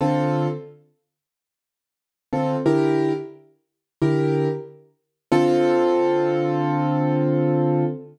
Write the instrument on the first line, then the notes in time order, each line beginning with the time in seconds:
acoustic grand piano
0.01 D3 C4 F4 A4
2.33 D3 C4 F4 A4
2.66 D3 E4 G4 A#4
4.02 D3 E4 G4 A#4
5.32 D3 C4 F4 A4